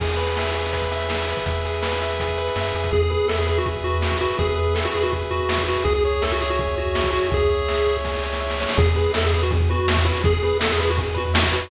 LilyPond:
<<
  \new Staff \with { instrumentName = "Lead 1 (square)" } { \time 4/4 \key e \major \tempo 4 = 164 r1 | r1 | gis'16 gis'16 gis'8 a'16 gis'16 gis'16 fis'16 r8 fis'4 fis'8 | gis'16 gis'16 gis'8 a'16 fis'16 gis'16 fis'16 r8 fis'4 fis'8 |
gis'16 gis'16 gis'8 a'16 fis'16 gis'16 fis'16 r8 fis'4 fis'8 | gis'2 r2 | gis'16 gis'16 gis'8 a'16 gis'16 gis'16 fis'16 r8 fis'4 fis'8 | gis'16 gis'16 gis'8 a'16 gis'16 gis'16 fis'16 r8 fis'4 fis'8 | }
  \new Staff \with { instrumentName = "Lead 1 (square)" } { \time 4/4 \key e \major gis'8 b'8 e''8 gis'8 b'8 e''8 gis'8 b'8 | e''8 gis'8 b'8 e''8 gis'8 b'8 e''8 gis'8 | gis'8 b'8 e''8 b'8 gis'8 b'8 e''8 b'8 | gis'8 b'8 e''8 b'8 gis'8 b'8 e''8 b'8 |
gis'8 cis''8 e''8 cis''8 gis'8 cis''8 e''8 cis''8 | gis'8 cis''8 e''8 cis''8 gis'8 cis''8 e''8 cis''8 | gis'8 b'8 e''8 b'8 gis'8 b'8 e''8 b'8 | gis'8 b'8 e''8 b'8 gis'8 b'8 e''8 b'8 | }
  \new Staff \with { instrumentName = "Synth Bass 1" } { \clef bass \time 4/4 \key e \major e,1 | e,2. fis,8 f,8 | e,1 | e,1 |
cis,1 | cis,1 | e,1 | e,1 | }
  \new DrumStaff \with { instrumentName = "Drums" } \drummode { \time 4/4 <cymc bd>16 hh16 hh16 hh16 sn16 hh16 hh16 hh16 <hh bd>16 <hh bd>16 hh16 hh16 sn16 hh16 hh16 <hh bd>16 | <hh bd>16 hh16 hh16 hh16 sn16 hh16 hh16 hh16 <hh bd>16 <hh bd>16 hh16 hh16 sn16 hh16 hh16 <hh bd>16 | <bd tomfh>16 tomfh16 tomfh16 tomfh16 sn16 tomfh16 tomfh16 tomfh16 <bd tomfh>16 <bd tomfh>16 tomfh16 tomfh16 sn16 <bd tomfh>16 tomfh16 tomfh16 | <bd tomfh>16 tomfh16 tomfh16 tomfh16 sn16 tomfh16 tomfh16 tomfh16 <bd tomfh>16 tomfh16 tomfh16 tomfh16 sn16 <bd tomfh>16 tomfh16 tomfh16 |
<bd tomfh>16 tomfh16 tomfh16 tomfh16 sn16 tomfh16 tomfh16 tomfh16 <bd tomfh>16 tomfh16 tomfh16 tomfh16 sn16 <bd tomfh>16 tomfh16 tomfh16 | <bd tomfh>16 tomfh16 tomfh16 tomfh16 sn16 tomfh16 tomfh16 tomfh16 <bd sn>16 sn16 sn16 sn16 r16 sn16 sn16 sn16 | <bd tomfh>16 tomfh16 tomfh16 tomfh16 sn16 tomfh16 tomfh16 tomfh16 <bd tomfh>16 <bd tomfh>16 tomfh16 tomfh16 sn16 <bd tomfh>16 tomfh16 tomfh16 | <bd tomfh>16 tomfh16 tomfh16 tomfh16 sn16 tomfh16 tomfh16 tomfh16 <bd tomfh>16 tomfh16 tomfh16 tomfh16 sn16 <bd tomfh>16 tomfh16 tomfh16 | }
>>